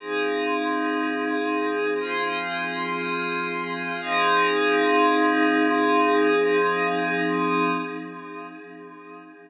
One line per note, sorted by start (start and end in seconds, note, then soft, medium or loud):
0.00 1.98 F3 medium
0.00 1.98 C4 medium
0.00 1.98 D#4 medium
0.00 1.98 G#4 medium
2.00 3.98 F3 medium
2.00 3.98 C4 medium
2.00 3.98 F4 medium
2.00 3.98 G#4 medium
4.00 7.70 F3 loud
4.00 7.70 C4 medium
4.00 7.70 D#4 medium
4.00 7.70 G#4 loud